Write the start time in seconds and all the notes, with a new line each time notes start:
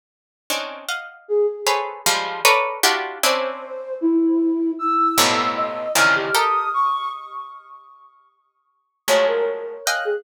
0.50 C4 C#4 D4 D#4
0.88 D#5 F5 F#5
1.28 G#4
1.67 G#4 A4 B4 C5 C#5
2.06 F3 G3 G#3
2.45 A4 A#4 B4 C#5 D5
2.83 D4 E4 F4 F#4 G4
3.23 C4 C#4 D4 E4 C5
4.01 E4
4.79 E6
5.18 F2 G2 A2 A#2 B2
5.56 D#5
5.95 A#2 C3 C#3 D#3 E3 F3 F6
6.16 G4
6.35 G4 A4 A#4 D#6
6.74 C#6
9.08 F3 F#3 G#3 A3 C#5
9.27 A#4
9.86 D#5 F5 G5 G#5 F#6
10.05 G#4